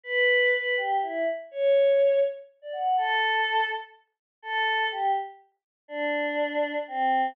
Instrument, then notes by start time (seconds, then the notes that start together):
choir aahs
0.03 B4
0.53 B4
0.77 G4
1.02 E4
1.51 C#5
2.62 D5
2.73 F#5
2.97 A4
4.42 A4
4.91 G4
5.88 D4
6.88 C4